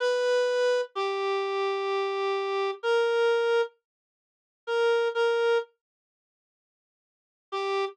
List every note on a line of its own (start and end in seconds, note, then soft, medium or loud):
0.00 0.81 B4 loud
0.95 2.71 G4 medium
2.83 3.61 A#4 loud
4.67 5.08 A#4 medium
5.15 5.58 A#4 medium
7.52 7.85 G4 loud